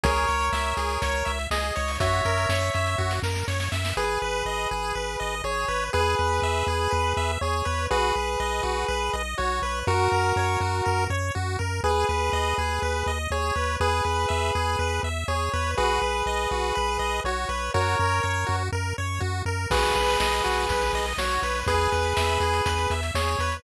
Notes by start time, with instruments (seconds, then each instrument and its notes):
0.03 synth bass 1 C#2, lead 1 (square) G#4 A#4 C#5, kick, closed hi-hat
0.16 closed hi-hat
0.27 synth bass 1 C#2, lead 1 (square) C#5, closed hi-hat
0.40 closed hi-hat
0.52 synth bass 1 C#2, lead 1 (square) E5, snare
0.65 closed hi-hat
0.77 synth bass 1 C#2, lead 1 (square) G#4, closed hi-hat
0.90 closed hi-hat
1.02 synth bass 1 C#2, lead 1 (square) C#5, kick, closed hi-hat
1.14 closed hi-hat
1.25 synth bass 1 C#2, lead 1 (square) E5, closed hi-hat
1.39 closed hi-hat
1.51 synth bass 1 C#2, lead 1 (square) G#4 D#5, snare
1.63 closed hi-hat
1.76 synth bass 1 C#2, lead 1 (square) C#5, closed hi-hat
1.88 open hi-hat
2.00 synth bass 1 F#2, lead 1 (square) F#4 C#5 E5, kick, closed hi-hat
2.13 closed hi-hat
2.25 synth bass 1 F#2, lead 1 (square) A#4, closed hi-hat
2.37 closed hi-hat
2.49 synth bass 1 F#2, lead 1 (square) C#5, snare
2.62 closed hi-hat
2.74 synth bass 1 F#2, lead 1 (square) E5, closed hi-hat
2.86 closed hi-hat
2.98 synth bass 1 F#2, lead 1 (square) F#4, kick
3.11 snare
3.23 synth bass 1 F#2, lead 1 (square) A#4, snare
3.35 snare
3.48 synth bass 1 F#2, lead 1 (square) C#5, snare
3.60 snare
3.72 synth bass 1 F#2, lead 1 (square) E5, snare
3.85 snare
3.97 synth bass 1 G#1, lead 1 (square) G#4 B4
4.22 synth bass 1 G#1, lead 1 (square) B4
4.45 synth bass 1 G#1, lead 1 (square) D#5
4.71 synth bass 1 G#1, lead 1 (square) G#4
4.95 synth bass 1 G#1, lead 1 (square) B4
5.20 synth bass 1 G#1, lead 1 (square) D#5
5.44 synth bass 1 G#1, lead 1 (square) G#4 C#5
5.68 synth bass 1 G#1, lead 1 (square) B4
5.93 synth bass 1 E2, lead 1 (square) G#4 B4
6.19 synth bass 1 E2, lead 1 (square) B4
6.42 synth bass 1 E2, lead 1 (square) E5
6.67 synth bass 1 E2, lead 1 (square) G#4
6.91 synth bass 1 E2, lead 1 (square) B4
7.17 synth bass 1 E2, lead 1 (square) E5
7.41 synth bass 1 E2, lead 1 (square) G#4 C#5
7.65 synth bass 1 E2, lead 1 (square) B4
7.90 synth bass 1 B1, lead 1 (square) F#4 G#4 B4
8.15 synth bass 1 B1, lead 1 (square) B4
8.40 synth bass 1 B1, lead 1 (square) D#5
8.63 synth bass 1 B1, lead 1 (square) F#4
8.88 synth bass 1 B1, lead 1 (square) B4
9.13 synth bass 1 B1, lead 1 (square) D#5
9.38 synth bass 1 B1, lead 1 (square) F#4 C#5
9.62 synth bass 1 B1, lead 1 (square) B4
9.87 synth bass 1 F#2, lead 1 (square) F#4 A#4
10.12 synth bass 1 F#2, lead 1 (square) A#4
10.36 synth bass 1 F#2, lead 1 (square) C#5
10.60 synth bass 1 F#2, lead 1 (square) F#4
10.85 synth bass 1 F#2, lead 1 (square) A#4
11.10 synth bass 1 F#2, lead 1 (square) C#5
11.35 synth bass 1 F#2, lead 1 (square) F#4
11.59 synth bass 1 F#2, lead 1 (square) A#4
11.83 synth bass 1 D#2, lead 1 (square) G#4 B4
12.09 synth bass 1 D#2, lead 1 (square) B4
12.33 synth bass 1 D#2, lead 1 (square) D#5
12.58 synth bass 1 D#2, lead 1 (square) G#4
12.82 synth bass 1 D#2, lead 1 (square) B4
13.06 synth bass 1 D#2, lead 1 (square) D#5
13.30 synth bass 1 D#2, lead 1 (square) G#4 C#5
13.55 synth bass 1 D#2, lead 1 (square) B4
13.80 synth bass 1 E2, lead 1 (square) G#4 B4
14.05 synth bass 1 E2, lead 1 (square) B4
14.29 synth bass 1 E2, lead 1 (square) E5
14.55 synth bass 1 E2, lead 1 (square) G#4
14.79 synth bass 1 E2, lead 1 (square) B4
15.03 synth bass 1 E2, lead 1 (square) E5
15.28 synth bass 1 E2, lead 1 (square) G#4 C#5
15.53 synth bass 1 E2, lead 1 (square) B4
15.77 synth bass 1 B1, lead 1 (square) F#4 G#4 B4
16.02 synth bass 1 B1, lead 1 (square) B4
16.26 synth bass 1 B1, lead 1 (square) D#5
16.51 synth bass 1 B1, lead 1 (square) F#4
16.75 synth bass 1 B1, lead 1 (square) B4
16.99 synth bass 1 B1, lead 1 (square) D#5
17.24 synth bass 1 B1, lead 1 (square) F#4 C#5
17.49 synth bass 1 B1, lead 1 (square) B4
17.74 synth bass 1 F#2, lead 1 (square) F#4 A#4 C#5
17.99 synth bass 1 F#2, lead 1 (square) A#4
18.23 synth bass 1 F#2, lead 1 (square) C#5
18.46 synth bass 1 F#2, lead 1 (square) F#4
18.72 synth bass 1 F#2, lead 1 (square) A#4
18.98 synth bass 1 F#2, lead 1 (square) C#5
19.20 synth bass 1 F#2, lead 1 (square) F#4
19.45 synth bass 1 F#2, lead 1 (square) A#4
19.70 synth bass 1 B1, lead 1 (square) F#4 G#4 B4, kick, crash
19.83 closed hi-hat
19.95 synth bass 1 B1, lead 1 (square) B4, closed hi-hat
20.08 closed hi-hat
20.20 synth bass 1 B1, lead 1 (square) D#5, snare
20.32 closed hi-hat
20.44 synth bass 1 B1, lead 1 (square) F#4, closed hi-hat
20.57 closed hi-hat
20.69 synth bass 1 B1, lead 1 (square) B4, kick, closed hi-hat
20.81 closed hi-hat
20.93 synth bass 1 B1, lead 1 (square) D#5, closed hi-hat
21.06 closed hi-hat
21.18 synth bass 1 B1, lead 1 (square) F#4 C#5, snare
21.31 closed hi-hat
21.42 synth bass 1 B1, lead 1 (square) B4, closed hi-hat
21.55 closed hi-hat
21.66 synth bass 1 E2, lead 1 (square) G#4 B4, kick, closed hi-hat
21.80 closed hi-hat
21.92 synth bass 1 E2, lead 1 (square) B4, closed hi-hat
22.04 closed hi-hat
22.16 synth bass 1 E2, lead 1 (square) E5, snare
22.29 closed hi-hat
22.40 synth bass 1 E2, lead 1 (square) G#4, closed hi-hat
22.53 closed hi-hat
22.66 synth bass 1 E2, lead 1 (square) B4, kick, closed hi-hat
22.78 closed hi-hat
22.90 synth bass 1 E2, lead 1 (square) E5, closed hi-hat
23.03 closed hi-hat
23.15 synth bass 1 E2, lead 1 (square) G#4 C#5, snare
23.27 closed hi-hat
23.39 synth bass 1 E2, lead 1 (square) B4, closed hi-hat
23.52 closed hi-hat